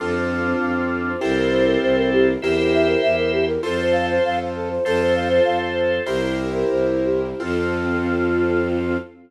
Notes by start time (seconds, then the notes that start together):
0.00 F2 C4 D4 F4 A4
0.16 C5
0.31 F5
0.45 C5
0.60 F2 F5
0.76 C5
0.92 A4
1.07 C5
1.19 C2 C4 E4 G4 A4 A#4 C5
1.37 A#4
1.51 C5
1.65 A#4
1.82 C2 C5
1.96 A#4
2.12 G4
2.27 A#4
2.41 E2 E4 G4 A#4 C5 E5
2.57 A#4
2.73 E5
2.88 A#4
3.02 E2 E5
3.18 A#4
3.32 G4
3.47 A#4
3.63 F2 F4 A4 C5
3.81 C5
3.92 F5
4.10 C5
4.24 F2 F5
4.40 C5
4.55 A4
4.70 C5
4.85 F2 F4 A4 C5
5.01 C5
5.15 F5
5.29 C5
5.45 F2 F5
5.60 C5
5.76 A4
5.91 C5
6.06 C2 E4 G4 A#4 C5
6.22 A#4
6.37 C5
6.55 A#4
6.70 C2 C5
6.85 A#4
7.05 G4
7.23 A#4
7.40 F2 C4 F4 A4